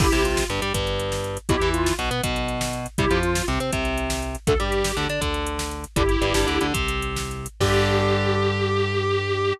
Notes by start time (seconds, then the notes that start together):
0.00 G1 D3 G3 E4 G4, kick, crash
0.12 C2 C3, closed hi-hat
0.25 F4, closed hi-hat
0.37 snare
0.49 G1 G2, closed hi-hat
0.62 G2 G3, closed hi-hat
0.74 G1 G2, kick, closed hi-hat
0.87 closed hi-hat
0.99 closed hi-hat
1.12 snare
1.24 closed hi-hat
1.37 closed hi-hat
1.49 B1 B2 F#3 E4 G4, kick, closed hi-hat
1.61 E2 E3, closed hi-hat
1.74 F4, closed hi-hat
1.86 snare
1.99 B1 B2, closed hi-hat
2.11 B2 B3, closed hi-hat
2.23 B1 B2, kick, closed hi-hat
2.36 closed hi-hat
2.48 closed hi-hat
2.61 snare
2.73 closed hi-hat
2.86 closed hi-hat
2.98 C2 C3 G3 E4 G4, kick, closed hi-hat
3.10 F2 F3, closed hi-hat
3.23 F4, closed hi-hat
3.35 snare
3.48 C2 C3, closed hi-hat
3.60 C3 C4, closed hi-hat
3.73 C2 C3, kick, closed hi-hat
3.85 closed hi-hat
3.98 closed hi-hat
4.10 snare
4.23 closed hi-hat
4.35 closed hi-hat
4.47 D2 D3 A3 A4, kick, closed hi-hat
4.60 G2 G3 G4, closed hi-hat
4.72 closed hi-hat
4.84 snare
4.97 D2 D3, closed hi-hat
5.09 D3 D4, closed hi-hat
5.21 D2 D3, kick, closed hi-hat
5.34 closed hi-hat
5.47 closed hi-hat
5.59 snare
5.71 closed hi-hat
5.84 closed hi-hat
5.96 G1 D3 G3 E4 G4, kick, closed hi-hat
6.09 closed hi-hat
6.21 G1 G2, closed hi-hat
6.34 G1 G2, snare
6.47 D2 D3, closed hi-hat
6.61 D2 D3, closed hi-hat
6.74 C2 C3, kick, closed hi-hat
6.88 closed hi-hat
7.02 closed hi-hat
7.16 snare
7.31 closed hi-hat
7.46 closed hi-hat
7.60 G2 D3 G3 G4, kick, crash